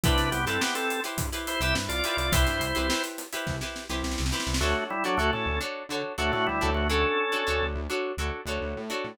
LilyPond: <<
  \new Staff \with { instrumentName = "Drawbar Organ" } { \time 4/4 \key c \mixolydian \tempo 4 = 105 <d' b'>8 <b g'>16 <c' a'>16 <b g'>16 <c' a'>8 r8. <e' c''>16 <g' e''>16 r16 <f' d''>8 <f' d''>16 | <e' c''>4. r2 r8 | \key d \mixolydian <a fis'>8 <g e'>16 <fis d'>16 <a fis'>16 <cis' a'>8 r4 <a fis'>16 <a fis'>16 <g e'>8 <a fis'>16 | <cis' a'>4. r2 r8 | }
  \new Staff \with { instrumentName = "Acoustic Guitar (steel)" } { \time 4/4 \key c \mixolydian <e' g' b' c''>8. <e' g' b' c''>16 <e' g' b' c''>8. <e' g' b' c''>8 <e' g' b' c''>8 <e' g' b' c''>8. <e' g' b' c''>8 | <e' g' b' c''>8. <e' g' b' c''>16 <e' g' b' c''>8. <e' g' b' c''>8 <e' g' b' c''>8 <e' g' b' c''>8. <e' g' b' c''>8 | \key d \mixolydian <d' fis' a' cis''>8. <d' fis' a' cis''>16 <d' fis' a' cis''>8. <d' fis' a' cis''>8 <d' fis' a' cis''>8 <d' fis' a' cis''>8. <d' fis' a' cis''>8 | <d' fis' a' cis''>8. <d' fis' a' cis''>16 <d' fis' a' cis''>8. <d' fis' a' cis''>8 <d' fis' a' cis''>8 <d' fis' a' cis''>8. <d' fis' a' cis''>8 | }
  \new Staff \with { instrumentName = "Synth Bass 1" } { \clef bass \time 4/4 \key c \mixolydian c,16 c,16 c,16 g,4~ g,16 g,8. c,16 g,16 c,8 c,16 | c,16 g,16 c,16 c,4~ c,16 c,8. c,16 c,16 c,8 c,16 | \key d \mixolydian d,4 d,16 a,16 d,8. d8 d,16 a,16 d,16 d,8~ | d,4 d,16 d,16 d,8. d,8 d,16 d,16 a,8 a,16 | }
  \new DrumStaff \with { instrumentName = "Drums" } \drummode { \time 4/4 <hh bd>16 <hh sn>16 <hh sn>16 hh16 sn16 hh16 hh16 hh16 <hh bd>16 hh16 hh16 hh16 sn16 hh16 hh16 <hh sn>16 | <hh bd>16 <hh sn>16 hh16 hh16 sn16 hh16 <hh sn>16 hh16 <bd sn>16 sn16 sn16 sn16 sn32 sn32 sn32 sn32 sn32 sn32 sn32 sn32 | r4 r4 r4 r4 | r4 r4 r4 r4 | }
>>